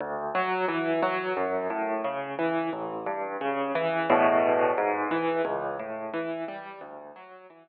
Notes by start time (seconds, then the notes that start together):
0.01 D2
0.35 F#3
0.68 E3
1.02 F#3
1.37 F#2
1.70 A2
2.04 C#3
2.39 E3
2.73 A1
3.06 G2
3.41 C#3
3.75 E3
4.10 E2 A2 B2
4.78 G#2
5.11 E3
5.45 C#2
5.79 A2
6.14 E3
6.48 G3
6.81 D2
7.16 F#3
7.50 E3